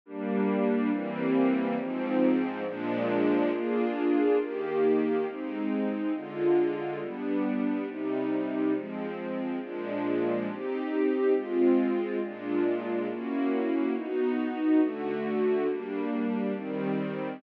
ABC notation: X:1
M:4/4
L:1/8
Q:1/4=138
K:Eb
V:1 name="String Ensemble 1"
[G,B,D]4 [=E,G,B,C]4 | [A,,F,C]4 [B,,F,A,D]4 | [B,DFA]4 [E,B,G]4 | [A,CE]4 [D,A,F]4 |
[G,=B,D]4 [C,G,E]4 | [F,A,C]4 [B,,F,A,D]4 | [CEG]4 [A,CF]4 | [B,,A,DF]4 [B,_D_F_G]4 |
[_CE_G]4 [D,=A,^F]4 | [G,B,D]4 [E,G,C]4 |]